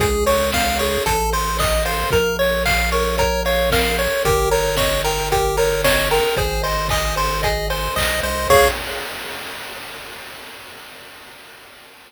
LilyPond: <<
  \new Staff \with { instrumentName = "Lead 1 (square)" } { \time 4/4 \key des \major \tempo 4 = 113 aes'8 des''8 f''8 des''8 a'8 c''8 ees''8 c''8 | bes'8 des''8 f''8 des''8 bes'8 des''8 f''8 des''8 | g'8 bes'8 des''8 bes'8 g'8 bes'8 des''8 bes'8 | aes'8 c''8 ees''8 c''8 aes'8 c''8 ees''8 c''8 |
des''4 r2. | }
  \new Staff \with { instrumentName = "Lead 1 (square)" } { \time 4/4 \key des \major aes'8 des''8 f''8 aes'8 a'8 c''8 ees''8 f''8 | bes'8 des''8 f''8 bes'8 des''8 f''8 bes'8 des''8 | bes'8 des''8 ees''8 g''8 bes'8 des''8 ees''8 g''8 | c''8 ees''8 aes''8 c''8 ees''8 aes''8 c''8 ees''8 |
<aes' des'' f''>4 r2. | }
  \new Staff \with { instrumentName = "Synth Bass 1" } { \clef bass \time 4/4 \key des \major des,2 a,,2 | bes,,1 | g,,1 | aes,,2. b,,8 c,8 |
des,4 r2. | }
  \new DrumStaff \with { instrumentName = "Drums" } \drummode { \time 4/4 <hh bd>8 hho8 <bd sn>8 hho8 <hh bd>8 hho8 <hc bd>8 hho8 | <hh bd>8 hho8 <hc bd>8 hho8 <hh bd>8 hho8 <bd sn>8 hho8 | <hh bd>8 hho8 <bd sn>8 hho8 <hh bd>8 hho8 <bd sn>8 hho8 | <hh bd>8 hho8 <hc bd>8 hho8 <hh bd>8 hho8 <hc bd>8 hho8 |
<cymc bd>4 r4 r4 r4 | }
>>